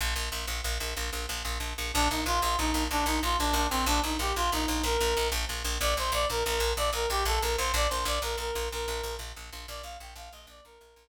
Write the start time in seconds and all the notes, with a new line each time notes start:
0.01 A#1
0.16 A#1
0.32 A#1
0.47 A#1
0.64 A#1
0.80 A#1
0.97 A#1
1.13 A#1
1.29 A#1
1.45 A#1
1.60 A#1
1.78 A#1
1.94 A#1 D4
2.10 A#1 D#4
2.26 A#1 F4
2.42 A#1 F4
2.58 A#1 D#4
2.74 A#1
2.91 A#1 D4
3.06 A#1 D#4
3.23 A#1 F4
3.39 A#1 D4
3.53 A#1 D4
3.70 A#1 C4
3.86 A#1 D4
4.03 A#1 D#4
4.19 A#1 G4
4.36 A#1 F4
4.52 A#1 D#4
4.68 A#1
4.83 A#1 A#4
5.01 A#1
5.17 A#1
5.32 A#1
5.49 A#1
5.65 A#1
5.80 A#1 D5
5.97 A#1 C5
6.12 A#1 D5
6.30 A#1 A#4
6.45 A#1 A#4
6.60 A#1
6.77 A#1 D5
6.93 A#1 A#4
7.10 A#1 G4
7.25 A#1 A4
7.41 A#1 A#4
7.57 A#1 C5
7.74 A#1 D5
7.89 A#1 C5
8.05 A#1 D5
8.22 A#1 A#4
8.38 A#1 A#4
8.55 A#1
8.72 A#1 A#4
8.88 A#1
9.03 A#1
9.19 A#1
9.36 A#1
9.53 A#1
9.68 A#1 D5
9.83 A#1 F5
10.00 A#1 G5
10.16 A#1 F5
10.32 A#1 D#5
10.47 A#1 D5
10.65 A#1 A#4
10.81 A#1
10.96 A#1